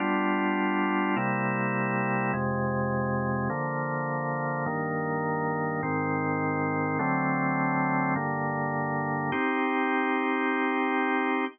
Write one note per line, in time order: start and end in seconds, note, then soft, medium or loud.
0.00 1.15 G3 loud
0.00 1.15 B3 medium
0.00 1.15 D4 loud
0.00 1.15 F4 loud
1.17 2.32 C3 medium
1.17 2.32 G3 medium
1.17 2.32 A#3 medium
1.17 2.32 E4 loud
2.33 3.49 F2 medium
2.33 3.49 C3 loud
2.33 3.49 G#3 loud
3.50 4.65 D3 loud
3.50 4.65 F3 medium
3.50 4.65 A#3 medium
4.66 5.81 G2 medium
4.66 5.81 D#3 loud
4.66 5.81 A#3 medium
5.83 6.98 G#2 loud
5.83 6.98 D#3 loud
5.83 6.98 C4 medium
6.99 8.14 D3 loud
6.99 8.14 F#3 medium
6.99 8.14 A3 medium
6.99 8.14 C4 loud
8.15 9.31 G2 loud
8.15 9.31 D3 loud
8.15 9.31 A#3 loud
9.32 11.45 C4 loud
9.32 11.45 D#4 medium
9.32 11.45 G4 loud